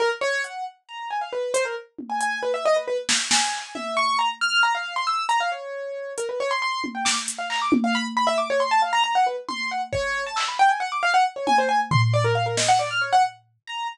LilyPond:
<<
  \new Staff \with { instrumentName = "Acoustic Grand Piano" } { \time 7/8 \tempo 4 = 136 ais'16 r16 cis''8 fis''8 r8 ais''8 gis''16 f''16 b'8 | c''16 ais'16 r8. gis''16 gis''8 b'16 e''16 dis''16 b'16 b'16 r16 | r8 gis''4 e''8 cis'''8 ais''16 r16 f'''8 | ais''16 f''8 c'''16 e'''8 ais''16 f''16 cis''4. |
ais'16 b'16 cis''16 c'''16 c'''8 r16 g''16 d'''16 r8 f''16 ais''16 d'''16 | r16 f''16 b''16 r16 b''16 e''16 d'''16 cis''16 c'''16 a''16 f''16 ais''16 ais''16 fis''16 | b'16 r16 c'''8 fis''16 r16 cis''8. a''16 e'''16 b''16 g''16 gis''16 | fis''16 d'''16 f''16 fis''16 r16 cis''16 gis''16 c''16 gis''16 r16 c'''16 c'''16 d''16 ais'16 |
f''16 ais'16 dis''16 fis''16 d''16 f'''16 cis''16 fis''16 r4 ais''8 | }
  \new DrumStaff \with { instrumentName = "Drums" } \drummode { \time 7/8 r4 hh4 r4. | hh4 tommh8 hh8 r4. | sn8 sn8 hc8 tommh8 r4. | r4 r8 hh8 r4. |
hh4 r8 tommh8 sn8 hh8 hc8 | tommh4 r4 r4. | r8 tommh8 r8 bd8 r8 hc4 | r4 r8 tommh8 r8 tomfh4 |
r8 sn8 r4 r4. | }
>>